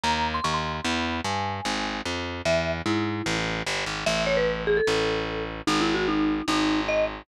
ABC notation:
X:1
M:4/4
L:1/16
Q:1/4=149
K:Ebdor
V:1 name="Marimba"
b3 c' d' c'2 c' | _c'4 a8 z4 | =e3 z =E6 z6 | [K:F#dor] e2 c B3 G A7 z2 |
(3D2 E2 F2 D4 D4 d2 z2 |]
V:2 name="Electric Bass (finger)" clef=bass
E,,4 E,,4 | _F,,4 =G,,4 A,,,4 =F,,4 | =E,,4 A,,4 =A,,,4 =G,,,2 _A,,,2 | [K:F#dor] A,,,8 A,,,8 |
G,,,8 G,,,8 |]